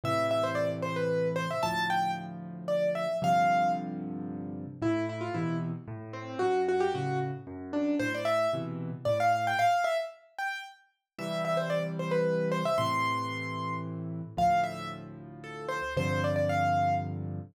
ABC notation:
X:1
M:3/4
L:1/16
Q:1/4=113
K:C
V:1 name="Acoustic Grand Piano"
e2 e c d z c B3 c e | a2 g2 z4 d2 e2 | f4 z8 | [K:Am] E2 E F E2 z4 C2 |
^F2 F G F2 z4 D2 | c d e2 z4 d f f g | f2 e z3 g2 z4 | [K:C] e2 e c d z c B3 c e |
c'8 z4 | f2 e2 z4 A2 c2 | c2 d d f4 z4 |]
V:2 name="Acoustic Grand Piano" clef=bass
[A,,C,E,]12 | [D,,A,,F,]12 | [G,,C,D,F,]12 | [K:Am] A,,4 [B,,C,E,]4 A,,4 |
^F,,4 [A,,^C,]4 F,,4 | A,,4 [B,,C,E,]4 A,,4 | z12 | [K:C] [C,E,G,]12 |
[A,,C,E,]12 | [D,,A,,F,]12 | [G,,C,D,F,]12 |]